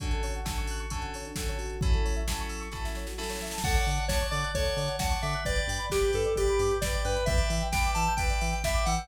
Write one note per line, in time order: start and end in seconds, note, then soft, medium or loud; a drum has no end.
0.00 0.41 D3 medium
0.00 0.41 C#4 medium
0.00 0.10 D4 medium
0.00 0.41 F#4 medium
0.00 0.41 A4 medium
0.00 kick medium
0.00 closed hi-hat medium
0.11 0.22 A4 medium
0.11 closed hi-hat medium
0.23 0.33 C#5 medium
0.23 open hi-hat medium
0.34 0.46 F#5 medium
0.34 closed hi-hat soft
0.45 0.86 D3 medium
0.45 0.86 C#4 medium
0.45 0.86 F#4 medium
0.45 0.86 A4 medium
0.45 0.55 A5 medium
0.45 kick medium
0.45 snare medium
0.57 0.68 C#6 medium
0.57 closed hi-hat medium
0.67 0.80 F#6 medium
0.67 open hi-hat medium
0.79 0.89 C#6 medium
0.79 closed hi-hat medium
0.90 1.32 D3 medium
0.90 1.32 C#4 medium
0.90 1.32 F#4 medium
0.90 1.32 A4 medium
0.90 1.01 A5 medium
0.90 kick medium
0.90 closed hi-hat medium
1.01 1.11 F#5 medium
1.01 closed hi-hat medium
1.14 1.25 C#5 medium
1.14 open hi-hat medium
1.25 1.36 D4 medium
1.25 closed hi-hat medium
1.36 1.77 D3 medium
1.36 1.77 C#4 medium
1.36 1.77 F#4 medium
1.36 1.46 A4 medium
1.36 1.77 A4 medium
1.36 kick medium
1.36 snare medium
1.48 1.58 C#5 medium
1.48 closed hi-hat medium
1.58 1.91 F#4 medium
1.58 open hi-hat medium
1.70 closed hi-hat medium
1.81 2.23 F#3 medium
1.81 2.23 C#4 medium
1.81 2.23 E4 medium
1.81 2.23 A4 medium
1.81 kick loud
1.81 closed hi-hat medium
1.93 2.04 A4 medium
1.93 closed hi-hat soft
2.04 2.15 C#5 medium
2.04 open hi-hat medium
2.16 2.26 E5 medium
2.16 closed hi-hat medium
2.28 2.68 F#3 medium
2.28 2.68 C#4 medium
2.28 2.68 E4 medium
2.28 2.68 A4 medium
2.28 2.39 A5 medium
2.28 kick medium
2.28 snare medium
2.38 2.50 C#6 medium
2.38 closed hi-hat medium
2.49 2.59 E6 medium
2.49 open hi-hat medium
2.60 2.70 C#6 medium
2.60 closed hi-hat medium
2.72 3.13 F#3 medium
2.72 3.13 C#4 medium
2.72 3.13 E4 medium
2.72 3.13 A4 medium
2.72 2.83 A5 medium
2.72 kick medium
2.72 snare soft
2.84 2.95 E5 medium
2.84 snare medium
2.95 3.06 C#5 medium
2.95 snare medium
3.07 3.17 F#4 medium
3.07 snare medium
3.18 3.59 F#3 medium
3.18 3.59 C#4 medium
3.18 3.59 E4 medium
3.18 3.59 A4 medium
3.18 3.29 A4 medium
3.18 snare medium
3.23 snare medium
3.29 3.39 C#5 medium
3.29 snare medium
3.35 snare medium
3.41 3.52 E5 medium
3.41 snare medium
3.47 snare medium
3.51 3.62 A5 medium
3.51 snare medium
3.58 snare medium
3.63 3.76 D2 medium
3.63 3.75 A4 medium
3.63 4.05 C#5 medium
3.63 4.05 D5 medium
3.63 4.05 F#5 loud
3.63 4.05 A5 medium
3.63 kick medium
3.63 crash medium
3.74 3.85 C#5 medium
3.74 closed hi-hat medium
3.86 3.99 D3 medium
3.86 3.96 D5 medium
3.86 open hi-hat medium
3.98 4.09 F#5 medium
3.98 closed hi-hat medium
4.08 4.22 D2 medium
4.08 4.27 C#5 loud
4.08 4.50 C#5 medium
4.08 4.50 D5 medium
4.08 4.50 F#5 medium
4.08 4.19 A5 medium
4.08 4.50 A5 medium
4.08 kick medium
4.08 snare medium
4.21 4.31 C#6 medium
4.21 closed hi-hat medium
4.30 4.44 D3 medium
4.30 4.51 D5 loud
4.30 4.40 D6 medium
4.30 open hi-hat medium
4.43 4.54 F#6 medium
4.43 closed hi-hat medium
4.54 4.67 D2 medium
4.54 4.65 A4 medium
4.54 4.96 C#5 medium
4.54 4.96 C#5 loud
4.54 4.96 D5 medium
4.54 4.96 F#5 medium
4.54 4.96 A5 medium
4.54 kick medium
4.54 closed hi-hat medium
4.64 4.75 C#5 medium
4.64 closed hi-hat medium
4.77 4.89 D3 medium
4.77 4.88 D5 medium
4.77 open hi-hat medium
4.88 4.98 F#5 medium
4.88 closed hi-hat medium
4.99 5.14 D2 medium
4.99 5.40 C#5 medium
4.99 5.40 D5 medium
4.99 5.40 F#5 medium
4.99 5.18 F#5 medium
4.99 5.40 A5 medium
4.99 5.10 A5 medium
4.99 kick medium
4.99 snare medium
5.10 5.20 C#6 medium
5.10 closed hi-hat medium
5.22 5.35 D3 medium
5.22 5.44 E5 medium
5.22 5.33 D6 medium
5.22 open hi-hat medium
5.33 5.44 F#6 medium
5.33 closed hi-hat medium
5.45 5.59 G1 medium
5.45 5.55 B4 medium
5.45 5.86 B4 medium
5.45 5.86 D5 medium
5.45 5.85 D5 loud
5.45 5.86 G5 medium
5.45 kick medium
5.45 closed hi-hat medium
5.56 5.67 D5 medium
5.56 closed hi-hat medium
5.67 5.80 G2 medium
5.67 5.78 G5 medium
5.67 open hi-hat medium
5.78 5.88 B5 medium
5.78 closed hi-hat medium
5.90 6.03 G1 medium
5.90 6.11 G4 loud
5.90 6.32 B4 medium
5.90 6.32 D5 medium
5.90 6.32 G5 medium
5.90 6.01 D6 medium
5.90 kick medium
5.90 snare medium
6.03 6.13 G6 medium
6.03 closed hi-hat medium
6.13 6.27 G2 medium
6.13 6.34 A4 medium
6.13 6.24 B4 medium
6.13 open hi-hat medium
6.24 6.35 D5 medium
6.24 closed hi-hat medium
6.36 6.48 G1 medium
6.36 6.74 G4 loud
6.36 6.78 B4 medium
6.36 6.78 D5 medium
6.36 6.46 G5 medium
6.36 6.78 G5 medium
6.36 kick medium
6.36 closed hi-hat medium
6.48 6.59 B5 medium
6.48 closed hi-hat medium
6.59 6.72 G2 medium
6.59 6.70 D6 medium
6.59 open hi-hat medium
6.70 6.81 G6 medium
6.70 closed hi-hat medium
6.81 6.94 G1 medium
6.81 7.23 B4 medium
6.81 6.92 B4 medium
6.81 7.02 D5 medium
6.81 7.23 D5 medium
6.81 7.23 G5 medium
6.81 kick medium
6.81 snare medium
6.93 7.04 D5 medium
6.93 closed hi-hat medium
7.04 7.17 G2 medium
7.04 7.25 B4 loud
7.04 7.14 G5 medium
7.04 open hi-hat medium
7.14 7.25 B5 medium
7.14 closed hi-hat medium
7.26 7.40 E2 loud
7.26 7.37 B4 medium
7.26 7.68 B4 medium
7.26 7.68 D5 medium
7.26 7.63 E5 loud
7.26 7.68 E5 medium
7.26 7.68 G5 medium
7.26 kick loud
7.26 closed hi-hat medium
7.37 7.48 D5 medium
7.37 closed hi-hat medium
7.50 7.62 E3 medium
7.50 7.61 E5 medium
7.50 open hi-hat medium
7.61 7.72 G5 medium
7.61 closed hi-hat medium
7.72 7.85 E2 medium
7.72 8.13 B4 medium
7.72 8.13 D5 medium
7.72 8.13 E5 medium
7.72 7.90 G5 loud
7.72 8.13 G5 medium
7.72 7.83 B5 medium
7.72 kick medium
7.72 snare medium
7.83 7.95 D6 medium
7.83 closed hi-hat medium
7.94 8.08 E3 medium
7.94 8.14 A5 medium
7.94 8.06 E6 medium
7.94 open hi-hat medium
8.07 8.18 G6 medium
8.07 closed hi-hat medium
8.17 8.31 E2 medium
8.17 8.28 B4 medium
8.17 8.59 B4 medium
8.17 8.59 D5 medium
8.17 8.59 E5 medium
8.17 8.59 G5 medium
8.17 kick medium
8.17 closed hi-hat medium
8.29 8.39 D5 medium
8.29 closed hi-hat medium
8.40 8.54 E3 medium
8.40 8.51 E5 medium
8.40 open hi-hat medium
8.51 8.62 G5 medium
8.51 closed hi-hat medium
8.64 8.76 E2 medium
8.64 9.05 B4 medium
8.64 9.05 D5 medium
8.64 9.05 E5 medium
8.64 8.85 E5 medium
8.64 9.05 G5 medium
8.64 8.75 B5 medium
8.64 kick medium
8.64 snare medium
8.74 8.84 D6 medium
8.74 closed hi-hat medium
8.86 8.99 E3 medium
8.86 9.07 F#5 loud
8.86 8.98 E6 medium
8.86 open hi-hat medium
8.98 9.08 G6 medium
8.98 closed hi-hat medium